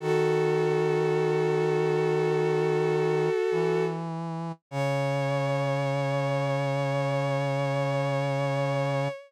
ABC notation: X:1
M:4/4
L:1/8
Q:1/4=51
K:C#m
V:1 name="Violin"
[FA]8 | c8 |]
V:2 name="Brass Section" clef=bass
D,6 E,2 | C,8 |]